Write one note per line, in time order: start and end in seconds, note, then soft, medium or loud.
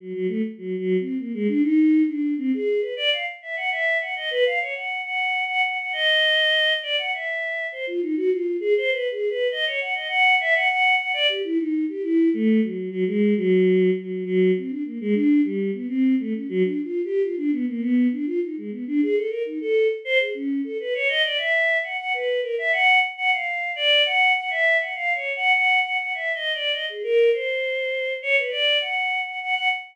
0.00 0.13 F#3 medium
0.13 0.27 F#3 medium
0.28 0.41 A3 medium
0.58 0.76 F#3 medium
0.79 0.97 F#3 loud
1.00 1.18 C4 medium
1.19 1.32 A#3 medium
1.34 1.47 G#3 loud
1.48 1.62 D4 loud
1.62 2.03 D#4 loud
2.08 2.34 D4 medium
2.38 2.51 C4 loud
2.54 2.81 G#4 medium
2.81 2.94 B4 medium
2.96 3.10 D5 loud
3.12 3.25 F5 medium
3.42 3.55 E5 medium
3.56 3.70 F#5 medium
3.71 3.98 E5 medium
4.01 4.14 F#5 medium
4.16 4.29 D#5 medium
4.31 4.44 B4 loud
4.46 4.59 F5 medium
4.61 4.74 C#5 medium
4.74 5.01 F#5 soft
5.04 5.44 F#5 medium
5.48 5.61 F#5 loud
5.64 5.77 F#5 medium
5.79 5.92 F#5 medium
5.93 6.73 D#5 loud
6.83 6.96 D5 medium
6.98 7.11 F#5 medium
7.13 7.67 E5 medium
7.72 7.85 C5 medium
7.87 8.00 F4 medium
8.02 8.15 D#4 medium
8.16 8.30 F#4 loud
8.30 8.57 F4 medium
8.60 8.74 G#4 loud
8.77 8.90 C5 loud
8.91 9.09 B4 medium
9.11 9.29 G#4 medium
9.30 9.47 B4 medium
9.51 9.65 D#5 medium
9.66 9.80 C#5 medium
9.81 9.94 F#5 medium
9.94 10.07 D#5 medium
10.08 10.35 F#5 loud
10.40 10.54 E5 loud
10.55 10.68 F#5 loud
10.68 10.95 F#5 loud
10.99 11.12 F#5 medium
11.13 11.27 D5 loud
11.29 11.42 G4 medium
11.44 11.58 E4 loud
11.58 11.85 D#4 medium
11.89 12.02 G4 medium
12.02 12.29 E4 loud
12.34 12.60 A3 loud
12.62 12.89 F#3 medium
12.91 13.04 F#3 loud
13.07 13.34 G#3 loud
13.37 13.90 F#3 loud
13.97 14.24 F#3 medium
14.25 14.52 F#3 loud
14.57 14.70 C4 medium
14.69 14.83 D4 medium
14.85 14.98 A#3 medium
15.01 15.14 G#3 loud
15.14 15.41 D4 loud
15.44 15.71 G3 medium
15.73 15.87 B3 medium
15.88 16.15 C4 loud
16.20 16.33 A3 medium
16.33 16.47 C#4 medium
16.49 16.62 F#3 loud
16.63 16.81 D4 medium
16.84 17.01 F4 medium
17.04 17.22 G4 medium
17.22 17.36 F4 medium
17.37 17.50 D4 loud
17.52 17.65 B3 medium
17.68 17.81 A#3 medium
17.80 18.07 B3 loud
18.12 18.25 D4 medium
18.26 18.39 F4 medium
18.42 18.56 D#4 medium
18.57 18.71 G#3 medium
18.71 18.84 B3 medium
18.87 19.01 D4 loud
19.02 19.16 G#4 loud
19.15 19.29 A4 medium
19.29 19.43 A#4 medium
19.45 19.59 D#4 medium
19.61 19.88 A4 loud
20.05 20.18 C5 loud
20.20 20.33 G#4 medium
20.34 20.61 C#4 medium
20.64 20.77 A4 medium
20.80 20.93 B4 medium
20.94 21.08 C#5 loud
21.08 21.22 D#5 loud
21.24 21.37 D5 medium
21.37 21.78 E5 medium
21.83 21.97 F#5 medium
21.99 22.13 F#5 medium
22.14 22.40 B4 medium
22.42 22.56 A#4 medium
22.58 22.72 E5 loud
22.72 22.99 F#5 loud
23.17 23.31 F#5 loud
23.31 23.71 F5 medium
23.76 24.02 D5 loud
24.06 24.32 F#5 loud
24.36 24.50 F#5 medium
24.50 24.77 E5 loud
24.80 24.93 F#5 soft
24.95 25.13 F5 medium
25.14 25.32 C#5 medium
25.36 25.53 F#5 loud
25.53 25.80 F#5 loud
25.84 25.97 F#5 medium
25.99 26.13 F#5 medium
26.14 26.32 E5 medium
26.34 26.52 D#5 medium
26.54 26.72 D5 medium
26.72 26.85 D#5 medium
26.89 27.03 G#4 medium
27.03 27.30 A#4 loud
27.33 28.13 C5 medium
28.22 28.36 C#5 loud
28.37 28.50 B4 medium
28.51 28.78 D5 medium
28.81 29.21 F#5 medium
29.26 29.39 F#5 medium
29.42 29.55 F#5 loud
29.55 29.68 F#5 loud